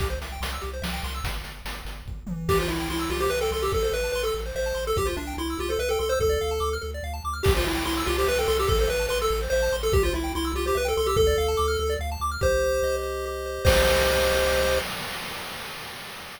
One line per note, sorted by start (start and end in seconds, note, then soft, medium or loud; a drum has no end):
0.00 0.18 C2 medium
0.00 0.08 G4 medium
0.00 kick medium
0.00 closed hi-hat medium
0.10 0.19 C5 medium
0.21 0.39 C2 medium
0.21 0.32 E5 medium
0.21 closed hi-hat medium
0.32 0.41 G5 medium
0.41 0.58 C2 medium
0.41 0.51 C6 medium
0.41 closed hi-hat medium
0.53 0.62 E6 medium
0.61 0.81 C2 medium
0.61 0.71 G4 medium
0.61 closed hi-hat soft
0.73 0.83 C5 medium
0.82 1.00 C2 medium
0.82 0.91 E5 medium
0.82 snare medium
0.93 1.02 G5 medium
1.03 1.21 C2 medium
1.03 1.14 C6 medium
1.03 closed hi-hat medium
1.14 1.24 E6 medium
1.24 1.41 G1 medium
1.24 kick medium
1.24 closed hi-hat medium
1.44 1.62 G1 medium
1.44 closed hi-hat medium
1.65 1.83 G1 medium
1.65 closed hi-hat medium
1.85 2.03 G1 medium
1.85 closed hi-hat medium
2.06 2.23 G1 medium
2.06 kick medium
2.27 2.46 G1 medium
2.27 mid tom medium
2.48 2.66 C2 medium
2.48 2.59 G4 medium
2.48 2.58 G4 medium
2.48 kick medium
2.48 crash medium
2.59 2.70 F4 medium
2.59 2.68 C5 medium
2.68 2.86 C2 medium
2.68 2.89 E4 medium
2.68 2.77 E5 medium
2.80 2.89 G5 medium
2.89 3.06 C2 medium
2.89 3.11 E4 medium
2.89 2.99 C6 medium
2.99 3.09 E6 medium
3.10 3.27 C2 medium
3.10 3.20 F4 medium
3.10 3.20 G4 medium
3.20 3.30 G4 medium
3.20 3.29 C5 medium
3.30 3.49 C2 medium
3.30 3.39 B4 medium
3.30 3.40 E5 medium
3.41 3.51 A4 medium
3.41 3.51 G5 medium
3.51 3.69 C2 medium
3.51 3.63 A4 medium
3.51 3.61 C6 medium
3.62 3.72 G4 medium
3.62 3.72 E6 medium
3.72 3.90 A1 medium
3.72 3.81 A4 medium
3.72 3.83 A4 medium
3.72 kick medium
3.82 3.93 A4 medium
3.82 3.92 C5 medium
3.92 4.10 A1 medium
3.92 4.12 B4 medium
3.92 4.03 E5 medium
4.03 4.13 A5 medium
4.12 4.31 A1 medium
4.12 4.22 B4 medium
4.12 4.25 C6 medium
4.23 4.41 A4 medium
4.23 4.34 E6 medium
4.34 4.52 A1 medium
4.34 4.44 A4 medium
4.46 4.55 C5 medium
4.55 4.73 A1 medium
4.55 4.85 C5 medium
4.55 4.65 E5 medium
4.66 4.75 A5 medium
4.74 4.93 A1 medium
4.74 4.84 C6 medium
4.87 4.97 A4 medium
4.87 4.97 E6 medium
4.96 5.14 C2 medium
4.96 5.06 G4 medium
4.96 5.07 G4 medium
4.96 kick medium
5.05 5.16 F4 medium
5.05 5.15 C5 medium
5.16 5.34 C2 medium
5.16 5.34 D4 medium
5.16 5.26 E5 medium
5.27 5.36 G5 medium
5.37 5.55 C2 medium
5.37 5.58 E4 medium
5.37 5.48 C6 medium
5.50 5.59 E6 medium
5.59 5.76 C2 medium
5.59 5.70 F4 medium
5.59 5.68 G4 medium
5.69 5.80 A4 medium
5.69 5.78 C5 medium
5.79 5.96 C2 medium
5.79 5.89 B4 medium
5.79 5.88 E5 medium
5.89 5.99 A4 medium
5.89 6.00 G5 medium
5.99 6.17 C2 medium
5.99 6.10 A4 medium
5.99 6.08 C6 medium
6.09 6.19 C5 medium
6.09 6.19 E6 medium
6.20 6.37 D2 medium
6.20 6.75 A4 medium
6.20 6.31 A4 medium
6.20 kick medium
6.29 6.39 D5 medium
6.41 6.59 D2 medium
6.41 6.50 F5 medium
6.51 6.60 A5 medium
6.60 6.78 D2 medium
6.60 6.69 D6 medium
6.73 6.82 F6 medium
6.81 7.01 D2 medium
6.81 6.91 A4 medium
6.94 7.04 D5 medium
7.03 7.20 D2 medium
7.03 7.13 F5 medium
7.14 7.23 A5 medium
7.24 7.42 D2 medium
7.24 7.34 D6 medium
7.33 7.43 F6 medium
7.43 7.63 C2 medium
7.43 7.52 G4 loud
7.43 7.53 G4 medium
7.43 kick loud
7.43 crash medium
7.55 7.66 F4 medium
7.55 7.64 C5 medium
7.65 7.82 C2 medium
7.65 7.84 E4 medium
7.65 7.74 E5 medium
7.75 7.84 G5 medium
7.85 8.02 C2 medium
7.85 8.04 E4 medium
7.85 7.94 C6 loud
7.97 8.07 E6 medium
8.07 8.25 C2 loud
8.07 8.16 F4 medium
8.07 8.17 G4 medium
8.18 8.28 G4 medium
8.18 8.28 C5 medium
8.28 8.46 C2 medium
8.28 8.38 B4 medium
8.28 8.37 E5 medium
8.38 8.47 A4 medium
8.38 8.48 G5 medium
8.48 8.66 C2 loud
8.48 8.57 A4 medium
8.48 8.57 C6 medium
8.57 8.69 G4 medium
8.57 8.67 E6 medium
8.67 8.87 A1 medium
8.67 8.77 A4 loud
8.67 8.79 A4 medium
8.67 kick medium
8.79 8.89 A4 medium
8.79 8.90 C5 medium
8.88 9.07 A1 medium
8.88 9.06 B4 medium
8.88 8.97 E5 medium
8.99 9.09 A5 medium
9.09 9.28 A1 medium
9.09 9.18 B4 medium
9.09 9.19 C6 loud
9.22 9.39 A4 medium
9.22 9.31 E6 medium
9.30 9.48 A1 loud
9.30 9.41 A4 medium
9.42 9.51 C5 medium
9.50 9.69 A1 medium
9.50 9.76 C5 medium
9.50 9.62 E5 loud
9.62 9.72 A5 medium
9.72 9.90 A1 medium
9.72 9.82 C6 medium
9.83 9.93 A4 medium
9.83 9.93 E6 medium
9.92 10.10 C2 loud
9.92 10.03 G4 medium
9.92 10.03 G4 loud
9.92 kick loud
10.03 10.13 F4 medium
10.03 10.14 C5 medium
10.13 10.31 C2 medium
10.13 10.32 E4 medium
10.13 10.24 E5 medium
10.24 10.33 G5 medium
10.35 10.53 C2 medium
10.35 10.52 E4 medium
10.35 10.45 C6 loud
10.45 10.54 E6 medium
10.54 10.71 C2 medium
10.54 10.66 F4 medium
10.54 10.65 G4 medium
10.66 10.77 G4 medium
10.66 10.75 C5 medium
10.75 10.93 C2 medium
10.75 10.87 B4 medium
10.75 10.84 E5 medium
10.85 10.97 A4 medium
10.85 10.94 G5 medium
10.97 11.15 C2 medium
10.97 11.07 A4 medium
10.97 11.07 C6 medium
11.06 11.16 G4 medium
11.06 11.16 E6 loud
11.16 11.34 D2 medium
11.16 11.26 A4 loud
11.16 11.94 A4 medium
11.16 kick medium
11.27 11.36 D5 medium
11.38 11.55 D2 medium
11.38 11.47 F5 medium
11.48 11.58 A5 medium
11.57 11.77 D2 medium
11.57 11.66 D6 medium
11.68 11.77 F6 medium
11.79 11.97 D2 medium
11.79 11.89 A4 medium
11.90 11.99 D5 medium
11.99 12.17 D2 medium
11.99 12.10 F5 medium
12.12 12.21 A5 medium
12.20 12.37 D2 medium
12.20 12.31 D6 medium
12.31 12.41 F6 medium
12.41 12.80 C2 medium
12.41 13.25 G4 loud
12.41 12.96 C5 medium
12.41 kick medium
12.63 13.02 C5 medium
12.82 13.59 C2 medium
12.82 13.62 D#5 medium
13.03 13.45 C5 medium
13.26 13.65 G4 medium
13.46 13.65 C5 medium
13.65 14.79 C2 loud
13.65 14.79 G4 medium
13.65 14.79 C5 loud
13.65 14.79 D#5 loud
13.65 kick loud
13.65 crash loud